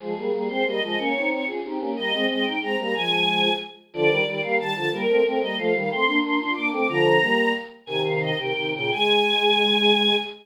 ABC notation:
X:1
M:6/8
L:1/8
Q:3/8=122
K:Ab
V:1 name="Choir Aahs"
A2 A c e e | d2 d A G G | e2 e g b b | a4 z2 |
[K:Bb] d2 d f a a | B2 B e f f | c'2 c' c' d' d' | b4 z2 |
[K:Ab] "^rit." a f e g2 g | a6 |]
V:2 name="Choir Aahs"
[F,A,] [G,B,] [G,B,] [A,C] [G,B,] [F,A,] | [B,D] [CE] [CE] [DF] [CE] [B,D] | [G,B,] [A,C] [A,C] [CE] [A,C] [G,B,] | [F,A,]4 z2 |
[K:Bb] [D,F,] [E,G,] [E,G,] [G,B,] [E,G,] [D,F,] | [G,B,] [A,C] [A,C] [G,B,] [F,A,] [E,G,] | [A,C] [B,D] [B,D] [DF] [B,D] [A,C] | [D,F,]2 [G,B,]2 z2 |
[K:Ab] "^rit." [C,E,]3 [C,E,] [C,E,] [B,,D,] | A,6 |]